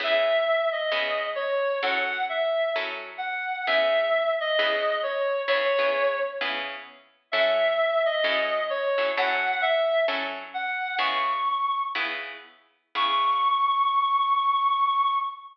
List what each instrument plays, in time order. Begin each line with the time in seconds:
0.00 acoustic guitar (steel) C#3 B3 E4 G#4, clarinet E5
0.72 clarinet D#5
0.92 acoustic guitar (steel) C#3 B3 E4 G#4
1.35 clarinet C#5
1.82 acoustic guitar (steel) F#3 C#4 E4 A4, clarinet F#5
2.29 clarinet E5
2.76 acoustic guitar (steel) F#3 C#4 E4 A4
3.18 clarinet F#5
3.67 acoustic guitar (steel) C#3 B3 E4 G#4, clarinet E5
4.40 clarinet D#5
4.59 acoustic guitar (steel) C#3 B3 E4 G#4
5.03 clarinet C#5
5.48 acoustic guitar (steel) C#3 B3 E4 G#4, clarinet C#5
5.79 acoustic guitar (steel) C#3 B3 E4 G#4
6.41 acoustic guitar (steel) C#3 B3 E4 G#4
7.32 acoustic guitar (steel) F#3 C#4 E4 A4, clarinet E5
8.05 clarinet D#5
8.24 acoustic guitar (steel) F#3 C#4 E4 A4
8.70 clarinet C#5
8.98 acoustic guitar (steel) F#3 C#4 E4 A4
9.17 acoustic guitar (steel) F#3 C#4 E4 A4, clarinet F#5
9.61 clarinet E5
10.08 acoustic guitar (steel) F#3 C#4 E4 A4
10.54 clarinet F#5
10.99 acoustic guitar (steel) C#3 B3 E4 G#4, clarinet C#6
11.95 acoustic guitar (steel) C#3 B3 E4 G#4
12.95 acoustic guitar (steel) C#3 B3 E4 G#4, clarinet C#6